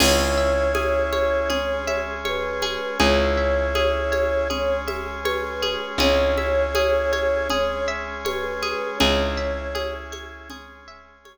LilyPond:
<<
  \new Staff \with { instrumentName = "Flute" } { \time 4/4 \key cis \dorian \tempo 4 = 80 cis''2. b'4 | cis''2. b'4 | cis''2. b'4 | cis''4. r2 r8 | }
  \new Staff \with { instrumentName = "Orchestral Harp" } { \time 4/4 \key cis \dorian gis'8 e''8 gis'8 cis''8 gis'8 e''8 cis''8 gis'8 | gis'8 e''8 gis'8 cis''8 gis'8 e''8 cis''8 gis'8 | gis'8 e''8 gis'8 cis''8 gis'8 e''8 cis''8 gis'8 | gis'8 e''8 gis'8 cis''8 gis'8 e''8 cis''8 r8 | }
  \new Staff \with { instrumentName = "Electric Bass (finger)" } { \clef bass \time 4/4 \key cis \dorian cis,1 | cis,1 | cis,1 | cis,1 | }
  \new Staff \with { instrumentName = "Drawbar Organ" } { \time 4/4 \key cis \dorian <cis' e' gis'>2 <gis cis' gis'>2 | <cis' e' gis'>2 <gis cis' gis'>2 | <cis' e' gis'>2 <gis cis' gis'>2 | <cis' e' gis'>2 <gis cis' gis'>2 | }
  \new DrumStaff \with { instrumentName = "Drums" } \drummode { \time 4/4 <cgl cymc>4 cgho8 cgho8 cgl8 cgho8 cgho8 cgho8 | cgl4 cgho8 cgho8 cgl8 cgho8 cgho8 cgho8 | cgl8 cgho8 cgho8 cgho8 cgl4 cgho8 cgho8 | cgl4 cgho8 cgho8 cgl4 cgho4 | }
>>